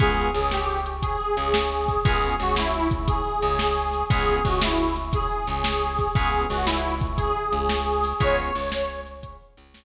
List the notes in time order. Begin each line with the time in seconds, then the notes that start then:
0.00 C#2 B3 C#4 F4 G#4, kick, closed hi-hat
0.34 C#2 C#3 G#4, closed hi-hat
0.51 G4, snare
0.86 closed hi-hat
1.02 G#4, kick, closed hi-hat
1.37 C#2 C#3, closed hi-hat
1.54 snare
1.88 kick, closed hi-hat
2.04 C#2 B3 C#4 F4 G#4, kick, closed hi-hat
2.40 C#2 C#3 F#4, closed hi-hat
2.56 E4, snare
2.91 kick, closed hi-hat
3.07 G#4, kick, closed hi-hat
3.42 C#2 C#3, closed hi-hat
3.59 snare
3.94 closed hi-hat
4.10 C#2 B3 C#4 F4 G#4, kick, closed hi-hat
4.45 C#2 C#3 F#4, kick, closed hi-hat
4.61 E4, snare
4.96 closed hi-hat
5.13 G#4, kick, closed hi-hat
5.47 C#2 C#3, closed hi-hat
5.64 snare
5.99 kick, closed hi-hat
6.15 C#2 B3 C#4 F4 G#4, kick, closed hi-hat
6.50 C#2 C#3 F#4, closed hi-hat
6.66 E4, snare
7.01 kick, closed hi-hat
7.17 G#4, kick, closed hi-hat
7.52 C#2 C#3, closed hi-hat
7.69 snare
8.04 open hi-hat
8.20 C#2 B3 C#4 F4 G#4 C#5, kick, closed hi-hat
8.55 C#2 C#3, closed hi-hat
8.72 snare
9.06 closed hi-hat
9.23 kick, closed hi-hat
9.57 C#2 C#3, closed hi-hat
9.74 snare